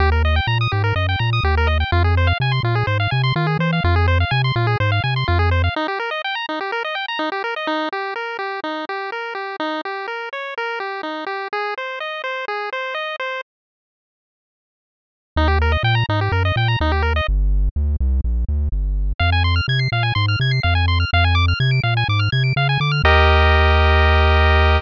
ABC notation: X:1
M:4/4
L:1/16
Q:1/4=125
K:Eb
V:1 name="Lead 1 (square)"
G B e g b e' G B e g b e' G B e g | F A c f a c' F A c f a c' F A c f | F A c f a c' F A c f a c' F A c f | E G B e g b E G B e g b E G B e |
E2 G2 B2 G2 E2 G2 B2 G2 | E2 G2 B2 _d2 B2 G2 E2 G2 | A2 c2 e2 c2 A2 c2 e2 c2 | z16 |
E G B e g b E G B e g b E G B e | z16 | f a c' f' a' c'' f a c' f' a' c'' f a c' f' | f a d' f' a' d'' f a d' f' a' d'' f a d' f' |
[GBe]16 |]
V:2 name="Synth Bass 1" clef=bass
E,,4 B,,2 A,,2 _G,,2 B,,2 E,,4 | F,,4 C,2 B,,2 A,,2 C,2 E,2 =E,2 | F,,4 C,2 B,,2 A,,2 C,2 F,,4 | z16 |
z16 | z16 | z16 | z16 |
E,,4 B,,2 A,,2 _G,,2 B,,2 E,,4 | G,,,4 D,,2 C,,2 B,,,2 D,,2 G,,,4 | F,,4 C,2 B,,2 A,,2 C,2 F,,4 | F,,4 C,2 B,,2 A,,2 C,2 _D,2 =D,2 |
E,,16 |]